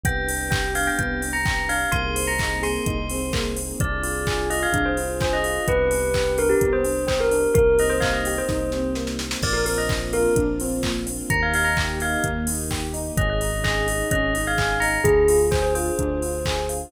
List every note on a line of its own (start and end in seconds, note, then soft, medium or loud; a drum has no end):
0.04 0.90 C2 medium
0.04 1.90 B3 medium
0.04 0.26 B3 loud
0.04 1.90 D4 medium
0.04 1.90 G4 medium
0.04 0.46 G5 medium
0.04 kick medium
0.04 closed hi-hat medium
0.29 0.50 D4 medium
0.29 open hi-hat medium
0.50 0.72 G4 medium
0.50 0.69 G5 medium
0.50 kick medium
0.50 clap medium
0.74 0.95 D4 medium
0.74 0.86 F5 medium
0.74 open hi-hat medium
0.87 0.98 G5 medium
0.99 1.86 C2 medium
0.99 1.21 B3 medium
0.99 1.30 G5 medium
0.99 kick medium
0.99 closed hi-hat medium
1.22 1.43 D4 medium
1.22 open hi-hat medium
1.33 1.67 A#5 medium
1.45 1.66 G4 medium
1.45 kick medium
1.45 clap medium
1.69 1.91 D4 medium
1.69 1.92 F5 medium
1.69 open hi-hat medium
1.92 2.78 C2 medium
1.92 2.13 A#3 loud
1.92 3.77 A#3 medium
1.92 3.77 C4 medium
1.92 3.77 D#4 medium
1.92 3.77 G#4 medium
1.92 2.24 C6 medium
1.92 kick medium
1.92 closed hi-hat medium
2.15 2.37 C4 medium
2.15 open hi-hat medium
2.27 2.57 A#5 medium
2.39 2.61 D#4 medium
2.39 kick medium
2.39 clap medium
2.62 2.83 G#4 medium
2.62 3.39 C6 medium
2.62 open hi-hat medium
2.86 3.73 C2 medium
2.86 3.08 D#4 medium
2.86 kick medium
2.86 closed hi-hat medium
3.10 3.31 C4 medium
3.10 open hi-hat medium
3.33 3.54 A#3 medium
3.33 kick medium
3.33 clap medium
3.56 3.77 C4 medium
3.56 open hi-hat medium
3.80 4.66 C2 medium
3.80 5.65 D4 medium
3.80 4.02 D4 loud
3.80 5.65 F4 medium
3.80 5.65 G#4 medium
3.80 4.37 D5 medium
3.80 kick medium
3.80 closed hi-hat medium
4.03 4.24 F4 medium
4.03 open hi-hat medium
4.27 4.48 G#4 medium
4.27 kick medium
4.27 clap medium
4.50 4.71 F4 medium
4.50 4.61 D#5 medium
4.50 open hi-hat medium
4.63 4.85 F5 medium
4.72 5.58 C2 medium
4.72 4.93 D4 medium
4.72 kick medium
4.72 closed hi-hat medium
4.85 5.20 C5 medium
4.97 5.18 F4 medium
4.97 open hi-hat medium
5.21 5.42 G#4 medium
5.21 5.33 C5 medium
5.21 kick medium
5.21 clap medium
5.33 5.66 D#5 medium
5.44 5.65 F4 medium
5.44 open hi-hat medium
5.67 6.54 C2 medium
5.67 7.53 B3 medium
5.67 5.89 B3 loud
5.67 7.53 D4 medium
5.67 7.53 G4 medium
5.67 6.33 B4 medium
5.67 kick medium
5.67 closed hi-hat medium
5.90 6.11 D4 medium
5.90 open hi-hat medium
6.14 6.36 G4 medium
6.14 kick medium
6.14 clap medium
6.38 6.59 D4 medium
6.38 6.50 A#4 medium
6.38 open hi-hat medium
6.49 6.70 G4 medium
6.61 7.47 C2 medium
6.61 6.83 B3 medium
6.61 kick medium
6.61 closed hi-hat medium
6.73 7.04 C5 medium
6.84 7.05 D4 medium
6.84 open hi-hat medium
7.06 7.28 G4 medium
7.06 7.19 C5 medium
7.06 kick medium
7.06 clap medium
7.20 7.49 A#4 medium
7.31 7.53 D4 medium
7.31 open hi-hat medium
7.54 8.41 C2 medium
7.54 7.76 A#3 loud
7.54 9.41 A#3 medium
7.54 9.41 C4 medium
7.54 9.41 D#4 medium
7.54 9.41 G4 medium
7.54 7.75 A#4 medium
7.54 kick medium
7.54 closed hi-hat medium
7.78 8.00 C4 medium
7.78 7.91 D#5 medium
7.78 open hi-hat medium
7.90 8.01 C5 medium
8.00 8.23 D#4 medium
8.00 8.12 F5 medium
8.00 kick medium
8.00 clap medium
8.13 8.34 D#5 medium
8.25 8.48 G4 medium
8.25 open hi-hat medium
8.38 9.04 C5 medium
8.48 9.35 C2 medium
8.48 8.69 D#4 loud
8.48 kick medium
8.48 snare medium
8.72 8.94 C4 medium
8.72 snare medium
8.95 9.17 A#3 medium
8.95 snare medium
9.07 snare medium
9.19 9.41 C4 medium
9.19 snare medium
9.31 snare medium
9.41 10.28 A#1 medium
9.41 9.64 A#3 loud
9.41 11.28 A#3 medium
9.41 11.28 C4 medium
9.41 11.28 D4 medium
9.41 11.28 F4 medium
9.41 9.54 D5 medium
9.41 kick medium
9.41 crash medium
9.53 9.64 A#4 medium
9.66 9.87 C4 medium
9.66 9.77 A#4 medium
9.66 open hi-hat medium
9.78 9.89 D#5 medium
9.89 10.11 D4 medium
9.89 kick medium
9.89 clap medium
10.13 10.34 F4 medium
10.13 10.34 A#4 medium
10.13 open hi-hat medium
10.36 11.22 A#1 medium
10.36 10.57 D4 loud
10.36 kick medium
10.36 closed hi-hat medium
10.60 10.82 C4 medium
10.60 open hi-hat medium
10.83 11.04 A#3 medium
10.83 kick medium
10.83 clap medium
11.06 11.28 C4 medium
11.06 open hi-hat medium
11.30 12.16 D#2 medium
11.30 11.52 A#3 loud
11.30 13.16 A#3 medium
11.30 13.16 D#4 medium
11.30 13.16 G4 medium
11.30 11.41 A#5 medium
11.30 kick medium
11.30 closed hi-hat medium
11.42 11.54 F5 medium
11.54 11.75 D#4 medium
11.54 11.66 F5 medium
11.54 open hi-hat medium
11.64 11.75 A#5 medium
11.77 11.99 G4 medium
11.77 kick medium
11.77 clap medium
12.00 12.22 D#4 medium
12.00 12.22 F5 medium
12.00 open hi-hat medium
12.24 13.10 D#2 medium
12.24 12.46 A#3 loud
12.24 kick medium
12.24 closed hi-hat medium
12.47 12.68 D#4 medium
12.47 open hi-hat medium
12.71 12.92 G4 medium
12.71 kick medium
12.71 clap medium
12.94 13.15 D#4 medium
12.94 open hi-hat medium
13.17 14.03 G#1 loud
13.17 13.38 C#4 loud
13.17 15.03 C#4 medium
13.17 15.03 D#4 medium
13.17 15.03 G#4 medium
13.17 13.29 D#5 medium
13.17 kick medium
13.17 closed hi-hat medium
13.30 13.63 D#5 medium
13.41 13.62 D#4 medium
13.41 open hi-hat medium
13.64 13.86 G#4 medium
13.64 14.04 D#5 medium
13.64 kick medium
13.64 clap medium
13.87 14.08 D#4 medium
13.87 open hi-hat medium
14.11 14.98 G#1 medium
14.11 14.32 C#4 loud
14.11 14.40 D#5 medium
14.11 kick medium
14.11 closed hi-hat medium
14.33 14.54 D#4 medium
14.33 open hi-hat medium
14.47 14.82 F5 medium
14.58 14.79 G#4 medium
14.58 kick medium
14.58 clap medium
14.80 15.03 D#4 medium
14.80 14.99 A#5 medium
14.80 open hi-hat medium
15.04 15.90 D2 medium
15.04 15.26 D4 loud
15.04 16.91 D4 medium
15.04 16.91 F4 medium
15.04 15.38 G#4 medium
15.04 16.91 G#4 medium
15.04 kick medium
15.04 closed hi-hat medium
15.28 15.49 F4 medium
15.28 open hi-hat medium
15.51 15.73 G#4 medium
15.51 15.62 C5 medium
15.51 kick medium
15.51 clap medium
15.62 15.73 C5 medium
15.75 15.97 F4 medium
15.75 16.69 C5 medium
15.75 open hi-hat medium
15.98 16.85 D2 medium
15.98 16.19 D4 medium
15.98 kick medium
15.98 closed hi-hat medium
16.22 16.43 F4 medium
16.22 open hi-hat medium
16.45 16.67 G#4 medium
16.45 kick medium
16.45 clap loud
16.69 16.90 F4 medium
16.69 open hi-hat medium